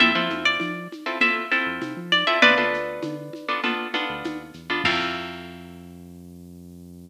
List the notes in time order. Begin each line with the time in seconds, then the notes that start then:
0.00 F2 C4 E4 F4 A4 E5, low conga, shaker
0.15 F3 C4 E4 F4 A4
0.30 F2, high conga, shaker
0.45 D5
0.60 F3, tambourine, high conga, shaker
0.92 high conga, shaker
1.06 C4 E4 F4 A4
1.21 C4 E4 F4 A4 E5, low conga, shaker
1.52 C4 E4 F4 A4, shaker
1.66 F2
1.81 C3, tambourine, high conga, shaker
1.97 F3
2.12 D5, high conga, shaker
2.27 C4 E4 F4 A4 E5
2.42 D2 B3 D4 F4 A4 B4 D5, low conga, shaker
2.58 D2 B3 D4 F4 A4
2.73 D2, shaker
3.03 D3, tambourine, high conga, shaker
3.33 high conga, shaker
3.48 B3 D4 F4 A4
3.63 B3 D4 F4 A4, low conga, shaker
3.94 B3 D4 F4 A4, high conga, shaker
4.09 D2
4.24 D#2, tambourine, high conga, shaker
4.54 E2, shaker
4.70 B3 D4 F4 A4
4.84 F2 C4 E4 F4 A4 F5, kick, crash